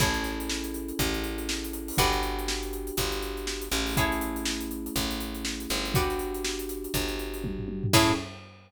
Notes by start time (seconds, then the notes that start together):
0.00 A1 C#4 E4 G#4 A4 C#5, kick, closed hi-hat
0.14 closed hi-hat
0.24 snare, closed hi-hat
0.40 closed hi-hat
0.49 snare
0.64 closed hi-hat
0.74 closed hi-hat
0.89 closed hi-hat
0.99 A1, kick, closed hi-hat
1.14 closed hi-hat
1.24 closed hi-hat
1.38 closed hi-hat
1.49 snare
1.64 closed hi-hat
1.73 closed hi-hat
1.88 open hi-hat
1.98 G1 B3 D4 F#4 G4 B4 D5, kick, closed hi-hat
2.13 closed hi-hat
2.23 closed hi-hat
2.39 closed hi-hat
2.48 snare
2.63 closed hi-hat
2.73 closed hi-hat
2.87 closed hi-hat
2.97 G1, kick, closed hi-hat
3.12 closed hi-hat
3.22 closed hi-hat
3.37 closed hi-hat
3.47 snare
3.62 closed hi-hat
3.71 A1 A3 C#4 E4 G#4, closed hi-hat
3.86 open hi-hat
3.97 E4 G#4 A4 C#5, kick, closed hi-hat
4.12 closed hi-hat
4.21 closed hi-hat
4.36 closed hi-hat
4.45 snare
4.61 closed hi-hat
4.71 closed hi-hat
4.86 closed hi-hat
4.96 A1, kick, closed hi-hat
5.11 closed hi-hat
5.20 closed hi-hat
5.35 closed hi-hat
5.45 snare
5.60 closed hi-hat
5.70 G1, snare, closed hi-hat
5.85 snare, closed hi-hat
5.94 B3 D4 F#4 G4 B4 D5, kick, closed hi-hat
6.10 snare, closed hi-hat
6.19 closed hi-hat
6.34 closed hi-hat
6.45 snare
6.59 closed hi-hat
6.69 snare, closed hi-hat
6.84 closed hi-hat
6.94 G1, kick, closed hi-hat
7.08 closed hi-hat
7.19 closed hi-hat
7.34 closed hi-hat
7.44 kick, high tom
7.59 floor tom
7.68 high tom
7.83 floor tom
7.93 A2 C#4 E4 G#4 A4 C#5, kick, crash